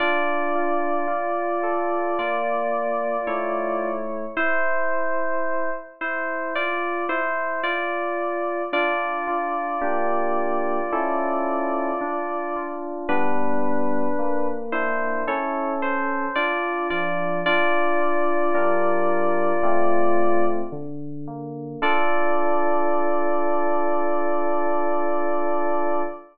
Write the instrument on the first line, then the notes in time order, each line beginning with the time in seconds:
electric piano 2
0.00 D4 F4 D5
0.55 F4
1.08 F4
1.63 A4
2.19 A#3 F4 D5
3.27 A3 E4 C#5
4.37 E4 C5
6.01 E4 C5
6.55 F4 D5
7.09 E4 C5
7.63 F4 D5
8.73 D4 F4 D5
9.27 F4
9.81 A#3 D4 G4
10.92 C#4 E4 A4
12.01 D4
12.56 F4
13.09 G3 B3 D4 B4
14.19 A#3
14.72 D4 E4 C5
15.27 C#4 E4 A4 C#5
15.82 C5
16.35 D4 F4 D5
16.90 F3 F4 D5
17.46 D4 F4 D5
18.00 F4
18.55 G3 D4 A#4
19.63 A3 C4 F4
20.72 D3
21.27 A#3
21.82 D4 F4 A4 D5